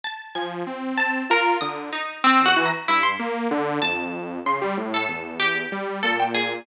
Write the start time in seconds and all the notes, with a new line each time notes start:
0.04 A5
0.35 F3 G#5
0.67 C4
0.98 A5
1.30 F4 A#4
1.61 D3 D#6
1.93 D#4
2.24 C4
2.40 E2
2.46 F#4
2.56 E3
2.66 A#5
2.88 G2 E4
3.03 C6
3.19 A#3
3.51 D3
3.82 F2 A5
4.46 C#3 C6
4.61 G3
4.77 A2
4.94 A4
5.09 E2
5.40 G4
5.72 G3
6.03 A#2 A4
6.20 G5
6.35 G#4